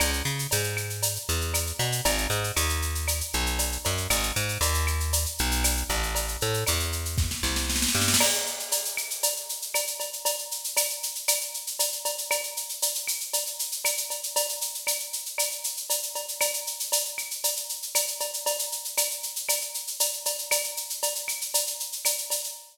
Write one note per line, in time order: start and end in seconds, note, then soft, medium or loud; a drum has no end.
0.00 0.22 C#2 medium
0.00 cowbell loud
0.00 claves loud
0.00 shaker loud
0.13 shaker medium
0.25 0.47 C#3 medium
0.25 shaker medium
0.39 shaker medium
0.51 1.18 G#2 medium
0.51 cowbell medium
0.51 shaker loud
0.64 shaker medium
0.77 claves loud
0.77 shaker medium
0.90 shaker medium
1.02 cowbell medium
1.02 shaker loud
1.16 shaker medium
1.29 1.72 E2 medium
1.29 shaker medium
1.41 shaker medium
1.54 cowbell medium
1.54 claves medium
1.54 shaker loud
1.67 shaker medium
1.79 2.01 B2 medium
1.79 cowbell medium
1.79 shaker medium
1.92 shaker medium
2.05 2.27 G#1 medium
2.05 cowbell loud
2.05 shaker loud
2.18 shaker medium
2.30 2.52 G#2 medium
2.30 shaker medium
2.44 shaker medium
2.56 3.22 D#2 medium
2.56 cowbell medium
2.56 claves medium
2.56 shaker loud
2.69 shaker medium
2.82 shaker medium
2.95 shaker medium
3.08 cowbell medium
3.08 claves medium
3.08 shaker loud
3.21 shaker medium
3.33 3.78 B1 medium
3.33 shaker medium
3.46 shaker medium
3.59 cowbell medium
3.59 shaker loud
3.72 shaker medium
3.85 4.07 F#2 medium
3.85 cowbell medium
3.85 shaker medium
3.97 shaker medium
4.10 4.32 G#1 medium
4.10 cowbell medium
4.10 claves loud
4.10 shaker loud
4.23 shaker medium
4.36 4.58 G#2 medium
4.36 shaker medium
4.49 shaker medium
4.61 5.26 D#2 medium
4.61 cowbell medium
4.61 shaker loud
4.74 shaker medium
4.87 claves loud
4.87 shaker medium
5.00 shaker medium
5.13 cowbell medium
5.13 shaker loud
5.26 shaker medium
5.38 5.84 B1 medium
5.38 shaker medium
5.51 shaker medium
5.64 cowbell medium
5.64 claves medium
5.64 shaker loud
5.77 shaker medium
5.90 6.37 A1 medium
5.90 cowbell medium
5.90 shaker medium
6.03 shaker medium
6.15 cowbell medium
6.15 shaker medium
6.28 shaker medium
6.41 6.64 A2 medium
6.41 shaker medium
6.54 shaker medium
6.66 7.34 E2 medium
6.66 cowbell medium
6.66 claves medium
6.66 shaker loud
6.80 shaker medium
6.92 shaker medium
7.05 shaker medium
7.18 kick medium
7.18 snare medium
7.31 snare medium
7.43 7.87 C2 medium
7.43 snare medium
7.56 snare medium
7.70 snare medium
7.76 snare medium
7.82 snare medium
7.88 snare medium
7.95 8.16 G2 medium
7.95 snare medium
8.01 snare medium
8.08 snare medium
8.14 snare loud
8.20 crash loud
8.20 cowbell loud
8.20 claves loud
8.34 shaker medium
8.46 shaker medium
8.59 shaker medium
8.72 cowbell medium
8.72 shaker loud
8.85 shaker medium
8.97 claves loud
8.97 shaker medium
9.10 shaker medium
9.23 cowbell medium
9.23 shaker loud
9.36 shaker medium
9.49 shaker medium
9.62 shaker medium
9.74 cowbell loud
9.74 claves loud
9.74 shaker loud
9.87 shaker medium
10.00 cowbell medium
10.00 shaker medium
10.13 shaker medium
10.25 cowbell loud
10.25 shaker loud
10.38 shaker medium
10.51 shaker medium
10.64 shaker medium
10.77 cowbell loud
10.77 claves loud
10.77 shaker loud
10.90 shaker medium
11.03 shaker medium
11.15 shaker medium
11.28 cowbell medium
11.28 claves loud
11.28 shaker loud
11.41 shaker medium
11.54 shaker medium
11.67 shaker medium
11.79 cowbell medium
11.79 shaker loud
11.92 shaker medium
12.05 cowbell medium
12.05 shaker loud
12.18 shaker medium
12.31 cowbell loud
12.31 claves loud
12.31 shaker loud
12.43 shaker medium
12.57 shaker medium
12.69 shaker medium
12.82 cowbell medium
12.82 shaker loud
12.95 shaker medium
13.07 claves medium
13.07 shaker loud
13.20 shaker medium
13.33 cowbell medium
13.33 shaker loud
13.46 shaker medium
13.59 shaker loud
13.72 shaker medium
13.85 cowbell medium
13.85 claves loud
13.85 shaker loud
13.97 shaker medium
14.10 cowbell medium
14.10 shaker medium
14.23 shaker medium
14.36 cowbell loud
14.36 shaker loud
14.49 shaker medium
14.61 shaker loud
14.74 shaker medium
14.87 cowbell medium
14.87 claves loud
14.87 shaker loud
15.00 shaker medium
15.13 shaker medium
15.26 shaker medium
15.38 cowbell medium
15.38 claves loud
15.38 shaker loud
15.51 shaker medium
15.64 shaker loud
15.77 shaker medium
15.90 cowbell medium
15.90 shaker loud
16.03 shaker medium
16.15 cowbell medium
16.15 shaker medium
16.28 shaker medium
16.41 cowbell loud
16.41 claves loud
16.41 shaker loud
16.54 shaker medium
16.67 shaker medium
16.80 shaker medium
16.92 cowbell medium
16.92 shaker loud
17.05 shaker medium
17.18 claves medium
17.18 shaker medium
17.31 shaker medium
17.44 cowbell medium
17.44 shaker loud
17.56 shaker medium
17.69 shaker medium
17.82 shaker medium
17.95 cowbell medium
17.95 claves medium
17.95 shaker loud
18.07 shaker medium
18.20 cowbell medium
18.20 shaker medium
18.34 shaker medium
18.46 cowbell loud
18.46 shaker loud
18.59 shaker loud
18.72 shaker medium
18.85 shaker medium
18.97 cowbell medium
18.97 claves loud
18.97 shaker loud
19.11 shaker medium
19.23 shaker medium
19.36 shaker medium
19.49 cowbell medium
19.49 claves loud
19.49 shaker loud
19.61 shaker medium
19.74 shaker medium
19.87 shaker medium
20.00 cowbell medium
20.00 shaker loud
20.13 shaker medium
20.25 cowbell medium
20.25 shaker loud
20.38 shaker medium
20.51 cowbell loud
20.51 claves loud
20.51 shaker loud
20.64 shaker medium
20.77 shaker medium
20.90 shaker medium
21.02 cowbell loud
21.02 shaker loud
21.15 shaker medium
21.28 claves loud
21.28 shaker medium
21.41 shaker medium
21.54 cowbell medium
21.54 shaker loud
21.67 shaker medium
21.80 shaker medium
21.92 shaker medium
22.05 cowbell medium
22.05 claves medium
22.05 shaker loud
22.18 shaker medium
22.30 cowbell medium
22.30 shaker loud
22.44 shaker medium